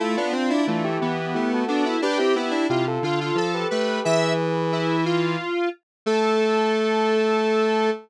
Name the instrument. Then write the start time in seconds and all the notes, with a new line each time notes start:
lead 1 (square)
0.00 A3 E4 F4 A4
0.16 B3 D4 F4
0.33 C4 D4 F4
0.50 D4 E4
0.67 E3 A3 D4 F4
0.84 E4 G4
1.01 E3 B3 E4 G4
1.34 A3 E4 G4
1.53 F#4 A4
1.68 B3 D4 F#4 A4
1.85 E4
2.02 D4 G4 B4
2.18 C4 E4 G4
2.35 B3 E4 G4
2.51 D4
2.69 C3 E4 F4 G4
2.87 F4 A4
3.02 D3 F4 A4
3.21 F4
3.35 F3 F4 A4
3.54 G4 B4
3.71 A3 G4 B4
4.04 E3 G#4 B4 E5
4.72 E4
5.05 F4
6.06 A3 A4